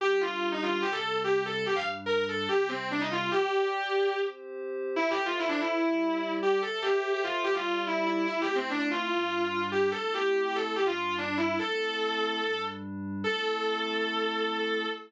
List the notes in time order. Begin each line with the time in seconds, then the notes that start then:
0.00 G3 D4 G4
0.21 F4
0.52 D#4
0.62 F4
0.81 C3 G3 C4 G4
0.92 A4
1.24 G4
1.46 A4
1.66 G2 G3 D4 G4
1.75 F5
2.06 A#4
2.29 A4
2.48 C3 G3 C4 G4
2.68 C4
2.91 D4
3.00 D#4
3.11 F4
3.31 G4 D5 G5
4.14 C4 G4 C5
4.96 E4 A4 C5 E5
5.10 G4
5.26 F4
5.38 E4
5.48 D4
5.60 E4
5.79 G3 G4 D5
6.42 G4
6.62 A4 C5 E5
6.82 G4
7.13 G4
7.23 F4
7.44 G3 G4 D5
7.54 F4
7.87 E4
8.06 E4
8.27 A3 C4 E4
8.41 G4
8.55 C4
8.70 D4
8.79 D4
8.91 F4
9.11 G2 G3 D4
9.72 G4
9.91 A3 C4 E4 A4
10.14 G4
10.45 G4
10.55 A4
10.76 G2 G3 D4 G4
10.86 F4
11.18 D4
11.37 E4
11.59 A3 C4 E4 A4
12.41 G2 G3 D4
13.24 A3 C4 E4 A4